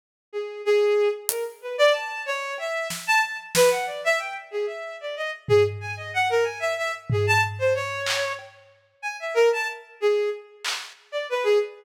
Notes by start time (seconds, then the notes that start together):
0.33 G#4
0.65 G#4
1.29 A#4, closed hi-hat
1.62 B4
1.78 D5
1.93 A5
2.26 C#5
2.58 E5, cowbell
2.90 snare
3.07 A5
3.23 A5
3.55 B4, snare
3.71 F#5
3.86 D5
4.04 E5
4.19 G5
4.51 G#4
4.67 E5
5.01 D5
5.16 D#5
5.48 G#4, floor tom
5.81 G#5
5.97 D#5
6.14 F#5
6.30 A#4
6.44 G#5
6.60 E5
6.77 E5
7.10 G#4, floor tom
7.27 A5
7.59 C5
7.75 C#5
8.06 clap
8.39 cowbell
9.02 G#5
9.20 E5
9.34 A#4
9.53 A5
10.00 G#4
10.65 clap
11.12 D5
11.29 B4
11.44 G#4